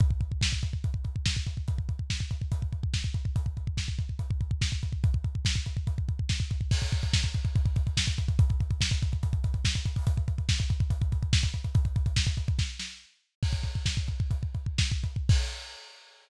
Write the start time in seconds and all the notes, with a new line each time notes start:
0.00 kick, closed hi-hat
0.10 kick
0.21 kick, closed hi-hat
0.32 kick
0.41 kick, snare
0.52 kick
0.63 kick, closed hi-hat
0.73 kick
0.84 kick, closed hi-hat
0.94 kick
1.04 kick, closed hi-hat
1.16 kick
1.26 kick, snare
1.36 kick
1.47 kick, closed hi-hat
1.57 kick
1.68 kick, closed hi-hat
1.78 kick
1.89 kick, closed hi-hat
1.99 kick
2.10 kick, snare
2.20 kick
2.31 kick, closed hi-hat
2.41 kick
2.52 kick, closed hi-hat
2.62 kick
2.73 kick, closed hi-hat
2.83 kick
2.94 kick, snare
3.04 kick
3.14 kick, closed hi-hat
3.25 kick
3.36 kick, closed hi-hat
3.46 kick
3.57 kick, closed hi-hat
3.67 kick
3.77 kick, snare
3.88 kick
3.99 kick, closed hi-hat
4.09 kick
4.19 kick, closed hi-hat
4.31 kick
4.41 kick, closed hi-hat
4.51 kick
4.61 kick, snare
4.72 kick
4.83 kick, closed hi-hat
4.92 kick
5.04 kick, closed hi-hat
5.14 kick
5.24 kick, closed hi-hat
5.35 kick
5.45 kick, snare
5.56 kick
5.66 kick, closed hi-hat
5.77 kick
5.87 kick, closed hi-hat
5.98 kick
6.08 kick, closed hi-hat
6.19 kick
6.29 kick, snare
6.40 kick
6.50 kick, closed hi-hat
6.61 kick
6.71 kick, crash
6.82 kick, closed hi-hat
6.92 kick, closed hi-hat
7.03 kick, closed hi-hat
7.13 kick, snare
7.24 kick, closed hi-hat
7.34 kick, closed hi-hat
7.45 kick, closed hi-hat
7.56 kick, closed hi-hat
7.65 kick, closed hi-hat
7.76 kick, closed hi-hat
7.87 kick, closed hi-hat
7.97 kick, snare
8.07 kick, closed hi-hat
8.18 kick, closed hi-hat
8.28 kick, closed hi-hat
8.39 kick, closed hi-hat
8.50 kick, closed hi-hat
8.60 kick, closed hi-hat
8.71 kick, closed hi-hat
8.81 kick, snare
8.91 kick, closed hi-hat
9.02 kick, closed hi-hat
9.12 kick, closed hi-hat
9.23 kick, closed hi-hat
9.33 kick, closed hi-hat
9.44 kick, closed hi-hat
9.54 kick, closed hi-hat
9.65 kick, snare
9.75 kick, closed hi-hat
9.85 kick, closed hi-hat
9.96 kick, open hi-hat
10.07 kick, closed hi-hat
10.17 kick, closed hi-hat
10.28 kick, closed hi-hat
10.38 kick, closed hi-hat
10.49 kick, snare
10.59 kick, closed hi-hat
10.70 kick, closed hi-hat
10.80 kick, closed hi-hat
10.90 kick, closed hi-hat
11.01 kick, closed hi-hat
11.12 kick, closed hi-hat
11.22 kick, closed hi-hat
11.33 kick, snare
11.43 kick, closed hi-hat
11.54 kick, closed hi-hat
11.64 kick, closed hi-hat
11.75 kick, closed hi-hat
11.85 kick, closed hi-hat
11.96 kick, closed hi-hat
12.06 kick, closed hi-hat
12.16 kick, snare
12.27 kick, closed hi-hat
12.37 kick, closed hi-hat
12.48 kick, closed hi-hat
12.59 kick, snare
12.79 snare
13.43 kick, crash
13.53 kick
13.63 kick, closed hi-hat
13.75 kick
13.86 kick, snare
13.97 kick
14.08 kick, closed hi-hat
14.20 kick
14.31 kick, closed hi-hat
14.43 kick
14.54 kick, closed hi-hat
14.66 kick
14.78 kick, snare
14.91 kick
15.04 kick, closed hi-hat
15.16 kick
15.29 kick, crash